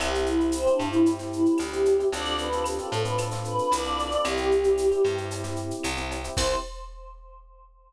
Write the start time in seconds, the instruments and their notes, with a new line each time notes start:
0.00 electric bass (finger) C2, electric piano 1 C4 E4 G4, choir aahs G4, cowbell, claves, shaker
0.15 shaker
0.26 choir aahs E4, shaker
0.40 electric piano 1 C4 E4 G4, shaker
0.52 choir aahs C4, tambourine, shaker
0.66 electric piano 1 C4 E4 G4, shaker
0.70 choir aahs D4
0.79 electric bass (finger) G2, electric piano 1 C4 E4 G4, claves, shaker
0.90 electric piano 1 C4 E4 G4, choir aahs E4, shaker
1.06 electric piano 1 C4 E4 G4, cowbell, shaker
1.19 electric piano 1 C4 E4 G4, snare, shaker
1.33 choir aahs E4, shaker
1.46 shaker
1.58 electric bass (finger) D2, choir aahs G4, tambourine, cowbell, claves, shaker
1.73 electric piano 1 C4 E4 G4, shaker
1.85 cowbell, shaker
2.00 electric piano 1 C4 E4 G4, shaker
2.12 electric bass (finger) D2, electric piano 1 C4 D4 F4 A4, choir aahs D5, cowbell, shaker
2.25 shaker
2.38 choir aahs B4, shaker
2.52 electric piano 1 C4 D4 F4 A4, shaker
2.64 choir aahs G4, tambourine, claves, shaker
2.78 electric piano 1 C4 D4 F4 A4, shaker
2.83 choir aahs A4
2.92 electric bass (finger) A2, electric piano 1 C4 D4 F4 A4, shaker
3.00 choir aahs B4
3.05 electric piano 1 C4 D4 F4 A4, shaker
3.18 electric piano 1 C4 D4 F4 A4, cowbell, claves, shaker
3.31 electric piano 1 C4 D4 F4 A4, snare, shaker
3.44 choir aahs B4, shaker
3.58 shaker
3.71 electric bass (finger) C2, choir aahs D5, tambourine, cowbell, shaker
3.84 electric piano 1 C4 D4 F4 A4, shaker
3.99 cowbell, shaker
4.11 electric piano 1 C4 D4 F4 A4, shaker
4.24 electric bass (finger) C2, electric piano 1 C4 E4 G4, choir aahs G4, cowbell, claves, shaker
4.37 shaker
4.51 shaker
4.64 electric piano 1 C4 E4 G4, shaker
4.78 tambourine, shaker
4.91 electric piano 1 C4 E4 G4, shaker
5.04 electric bass (finger) G2, electric piano 1 C4 E4 G4, claves, shaker
5.17 electric piano 1 C4 E4 G4, shaker
5.31 electric piano 1 C4 E4 G4, cowbell, shaker
5.44 electric piano 1 C4 E4 G4, snare, shaker
5.56 shaker
5.71 shaker
5.84 electric bass (finger) C2, tambourine, cowbell, claves, shaker
5.97 electric piano 1 C4 E4 G4, shaker
6.11 cowbell, shaker
6.24 electric piano 1 C4 E4 G4, shaker
6.37 electric bass (finger) C2, electric piano 1 C4 E4 G4, choir aahs C5, kick, crash